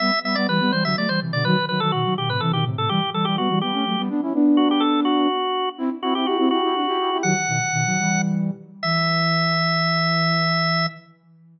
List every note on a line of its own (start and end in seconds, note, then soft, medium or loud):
0.00 0.11 G3 loud
0.00 0.11 B3 loud
0.00 0.20 E5 loud
0.24 0.35 G3 medium
0.24 0.35 B3 medium
0.24 0.36 E5 medium
0.35 0.47 G3 medium
0.35 0.47 B3 loud
0.35 0.47 D5 medium
0.48 0.60 E3 medium
0.48 0.60 G3 medium
0.48 0.72 B4 medium
0.60 0.72 G3 medium
0.60 0.72 B3 loud
0.72 0.84 E3 medium
0.72 0.84 G3 medium
0.72 0.84 C5 medium
0.84 0.96 D3 medium
0.84 0.96 F#3 medium
0.84 0.96 E5 medium
0.96 1.08 F#3 medium
0.96 1.08 A3 medium
0.96 1.09 D5 medium
1.09 1.20 E3 medium
1.09 1.20 G3 medium
1.09 1.20 C5 medium
1.21 1.32 C3 medium
1.21 1.32 E3 medium
1.32 1.44 B2 medium
1.32 1.44 D3 loud
1.32 1.44 D5 medium
1.45 1.56 D#3 loud
1.45 1.56 F#3 loud
1.45 1.65 B4 medium
1.69 1.80 D#3 medium
1.69 1.80 F#3 medium
1.69 1.80 B4 medium
1.80 1.92 D#3 medium
1.80 1.92 F#3 loud
1.80 1.92 A4 loud
1.92 2.04 B2 medium
1.92 2.04 D#3 medium
1.92 2.14 F#4 medium
2.04 2.16 D#3 medium
2.04 2.16 F#3 medium
2.17 2.29 B2 medium
2.17 2.29 D#3 medium
2.17 2.29 G4 medium
2.29 2.40 A2 medium
2.29 2.40 C3 medium
2.29 2.41 B4 medium
2.40 2.52 C3 medium
2.40 2.52 E3 loud
2.40 2.52 A4 medium
2.53 2.64 B2 medium
2.53 2.64 D#3 medium
2.53 2.65 G4 medium
2.65 2.76 A2 medium
2.65 2.76 C3 medium
2.77 2.89 A2 medium
2.77 2.89 C3 loud
2.77 2.90 A4 medium
2.89 3.01 E3 medium
2.89 3.01 G3 loud
2.89 3.10 G4 medium
3.13 3.24 E3 medium
3.13 3.24 G3 medium
3.13 3.26 A4 medium
3.25 3.37 E3 medium
3.25 3.37 G3 medium
3.25 3.36 G4 medium
3.38 3.49 G3 medium
3.38 3.49 B3 medium
3.38 3.59 F#4 medium
3.49 3.61 E3 medium
3.49 3.61 G3 medium
3.61 3.73 G3 medium
3.61 3.73 B3 medium
3.61 4.02 G4 medium
3.73 3.84 A3 medium
3.73 3.84 C#4 medium
3.86 3.97 F#3 medium
3.86 3.97 A3 medium
3.98 4.10 G3 medium
3.98 4.09 B3 loud
4.09 4.21 B3 medium
4.09 4.21 D4 loud
4.22 4.33 C#4 medium
4.22 4.33 E4 medium
4.34 5.28 B3 medium
4.34 5.28 D4 loud
4.57 4.69 F#4 medium
4.71 4.82 G4 medium
4.80 5.01 A4 medium
5.05 5.69 F#4 medium
5.78 5.89 C4 loud
5.78 5.89 E4 loud
6.02 6.14 C4 medium
6.02 6.14 E4 loud
6.02 6.14 F#4 medium
6.15 6.26 C4 medium
6.15 6.26 E4 medium
6.15 6.26 G4 medium
6.26 6.38 E4 medium
6.26 6.49 F#4 medium
6.26 6.38 G4 medium
6.38 6.50 C4 medium
6.38 6.50 E4 medium
6.51 6.62 E4 medium
6.51 7.18 F#4 medium
6.51 6.62 G4 medium
6.63 6.74 E4 medium
6.63 6.74 G4 medium
6.75 6.86 D4 medium
6.75 6.86 F#4 medium
6.87 6.98 E4 medium
6.87 6.98 G4 medium
6.98 7.10 E4 medium
6.98 7.10 G4 medium
7.11 7.23 E4 medium
7.11 7.23 G4 medium
7.23 7.35 D#3 medium
7.23 7.35 F#3 loud
7.23 8.22 F#5 medium
7.47 7.59 B2 medium
7.47 7.59 D#3 medium
7.72 7.85 B2 medium
7.72 7.85 D#3 loud
7.86 7.98 D#3 medium
7.86 7.98 F#3 loud
7.99 8.51 E3 medium
7.99 8.51 G3 medium
8.83 10.87 E3 loud
8.83 10.86 E5 loud